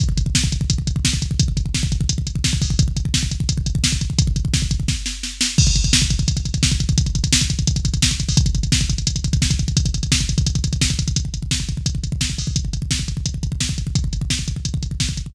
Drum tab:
CC |----------------|----------------|----------------|----------------|
HH |x-x---x-x-x---x-|x-x---x-x-x---o-|x-x---x-x-x---x-|x-x---x---------|
SD |----o-------o---|----o-------o---|----o-------o---|----o---o-o-o-o-|
BD |oooooooooooooooo|oooooooooooooooo|oooooooooooooooo|ooooooooo-------|

CC |x---------------|----------------|----------------|----------------|
HH |-xxx-xxxxxxx-xxx|xxxx-xxxxxxx-xxo|xxxx-xxxxxxx-xxx|xxxx-xxxxxxx-xxx|
SD |----o-------o---|----o-------o---|----o-------o---|----o-------o---|
BD |oooooooooooooooo|oooooooooooooooo|oooooooooooooooo|oooooooooooooooo|

CC |----------------|----------------|----------------|
HH |x-x---x-x-x---o-|x-x---x-x-x---x-|x-x---x-x-x---x-|
SD |----o-------o---|----o-------o---|----o-------o---|
BD |oooooooooooooooo|oooooooooooooooo|oooooooooooooooo|